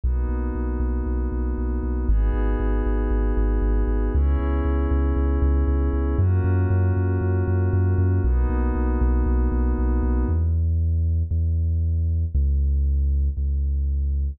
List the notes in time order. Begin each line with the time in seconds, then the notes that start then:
0.04 B1 A#3 B3 D#4 F#4
0.29 B1
0.55 B1
0.80 B1
1.06 B1
1.32 B1
1.58 B1
1.83 B1
2.09 G#1 B3 D#4 F#4 G#4
2.34 G#1
2.60 G#1
2.86 G#1
3.10 G#1
3.37 G#1
3.62 G#1
3.88 G#1
4.14 C#2 B3 C#4 E4 G#4
4.39 C#2
4.65 C#2
4.91 C#2
5.16 C#2
5.42 C#2
5.68 C#2
5.93 C#2
6.18 F#2 A#3 C#4 F4 F#4
6.44 F#2
6.70 F#2
6.96 F#2
7.21 F#2
7.48 F#2
7.73 F#2
7.98 F#2
8.24 B1 A#3 B3 D#4 F#4
8.50 B1
8.76 B1
9.01 B1
9.26 B1
9.52 B1
9.79 B1
10.03 B1
10.29 E2
11.31 E2
12.35 C#2
13.37 C#2